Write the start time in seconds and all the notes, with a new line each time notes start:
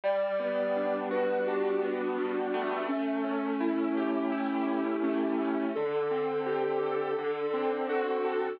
0.04 G3 D5
0.40 B3
0.76 D4
1.11 F#4 B4
1.46 D4 G4
1.82 B3
2.18 G3
2.54 A3
2.88 C#4
3.24 C#4
3.60 E4
3.97 G4
4.32 E4
4.67 C#4
5.03 A3 C#4
5.41 C#4
5.75 D3 A4
6.11 C4
6.46 G4
6.83 A4
7.19 D3
7.54 C4
7.89 F#4 A4
8.24 A4